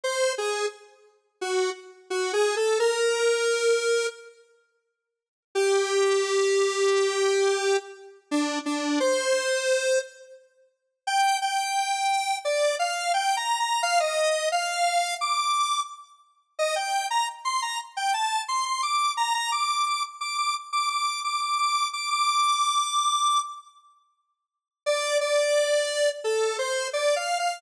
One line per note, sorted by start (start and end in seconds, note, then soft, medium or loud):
0.04 0.33 C5 loud
0.38 0.66 G#4 medium
1.41 1.70 F#4 medium
2.10 2.32 F#4 medium
2.33 2.55 G#4 loud
2.56 2.78 A4 medium
2.79 4.07 A#4 loud
5.55 7.77 G4 loud
8.31 8.59 D4 loud
8.66 8.99 D4 medium
9.00 9.99 C5 loud
11.07 11.37 G5 loud
11.42 12.37 G5 medium
12.45 12.75 D5 medium
12.79 13.12 F5 medium
13.14 13.36 G5 loud
13.37 13.58 A#5 medium
13.60 13.82 A#5 medium
13.83 13.99 F5 loud
14.00 14.49 D#5 medium
14.52 15.15 F5 loud
15.21 15.80 D6 medium
16.59 16.75 D#5 loud
16.76 17.06 G5 medium
17.10 17.27 A#5 loud
17.45 17.61 C6 medium
17.62 17.78 A#5 medium
17.97 18.13 G5 medium
18.14 18.42 A5 medium
18.48 18.65 C6 medium
18.66 18.82 C6 medium
18.83 19.12 D6 medium
19.17 19.33 A#5 medium
19.34 19.51 A#5 loud
19.52 19.85 D6 medium
19.86 20.03 D6 medium
20.21 20.37 D6 medium
20.38 20.54 D6 medium
20.73 20.89 D6 medium
20.90 21.20 D6 medium
21.24 21.41 D6 medium
21.41 21.58 D6 medium
21.58 21.88 D6 medium
21.93 22.09 D6 medium
22.10 23.40 D6 loud
24.86 25.18 D5 loud
25.21 26.09 D5 loud
26.24 26.57 A4 medium
26.59 26.88 C5 medium
26.93 27.15 D5 medium
27.16 27.38 F5 medium
27.39 27.61 F5 medium